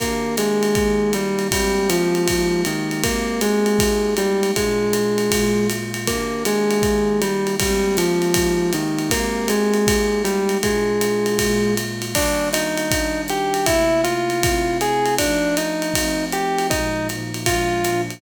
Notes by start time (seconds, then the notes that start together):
0.00 D#3 A#3 D4 G4 A#4, kick, ride
0.37 G#3 G#4, hi-hat pedal, ride
0.63 ride
0.75 D#3 A#3 D#4 G4, kick, ride
1.13 G3 G4, hi-hat pedal, ride
1.39 ride
1.51 G3 G#3 A#3 C4 G4, kick, ride
1.89 F3 F4, hi-hat pedal, ride
2.15 ride
2.28 G#3 A#3 D#4 G4, kick, ride
2.65 D#3 D#4, hi-hat pedal, ride
2.91 ride
3.04 G#3 A#3 C4 G4 A#4, kick, ride
3.41 G#3 G#4, hi-hat pedal, ride
3.66 ride
3.79 G#3 A#3 D#4 G4, kick, ride
4.17 G3 G4, hi-hat pedal, ride
4.43 ride
4.56 A#2 G#3 D4 F4 G#4, kick, ride
4.93 hi-hat pedal, ride
5.18 ride
5.31 A#2 G#3 A#3 F4, kick, ride
5.70 hi-hat pedal, ride
5.94 ride
6.07 D#3 A#3 D4 G4 A#4, kick, ride
6.45 G#3 G#4, hi-hat pedal, ride
6.71 ride
6.82 D#3 A#3 D#4 G4, kick, ride
7.22 G3 G4, hi-hat pedal, ride
7.47 ride
7.60 G3 G#3 A#3 C4 G4, kick, ride
7.97 F3 F4, hi-hat pedal, ride
8.22 ride
8.34 G#3 A#3 D#4 G4, kick, ride
8.73 D#3 D#4, hi-hat pedal, ride
8.99 ride
9.10 G#3 A#3 C4 G4 A#4, kick, ride
9.48 G#3 G#4, hi-hat pedal, ride
9.74 ride
9.87 G#3 A#3 D#4 G4, kick, ride
10.24 G3 G4, hi-hat pedal, ride
10.49 ride
10.63 A#2 G#3 D4 F4 G#4, kick, ride
11.01 hi-hat pedal, ride
11.26 ride
11.39 A#2 G#3 A#3 F4, kick, ride
11.77 hi-hat pedal, ride
12.02 ride
12.15 D#3 G3 A#3 D4 D5, kick, crash, ride
12.53 D#4 D#5, hi-hat pedal, ride
12.78 ride
12.91 D#3 G3 D4 D#4, kick, ride
13.28 G4 G5, hi-hat pedal, ride
13.54 ride
13.66 C3 A3 A#3 E4 E5, kick, ride
14.04 F4 F5, hi-hat pedal, ride
14.30 ride
14.43 C3 A3 C4 E4, kick, ride
14.81 G#4 G#5, hi-hat pedal, ride
15.06 ride
15.19 F3 A3 D4 D#4 D5, kick, ride
15.57 D#4 D#5, hi-hat pedal, ride
15.82 ride
15.94 F3 A3 C4 D#4, kick, ride
16.32 G4 G5, hi-hat pedal, ride
16.58 ride
16.70 A#2 F3 G#3 D#4 D#5, kick, ride
17.09 A#2 F3 A#3 D#4, hi-hat pedal, ride
17.34 ride
17.46 A#2 F3 G#3 D4 F4 F5, kick, ride
17.84 A#2 F3 A#3 D4, hi-hat pedal, ride
18.10 ride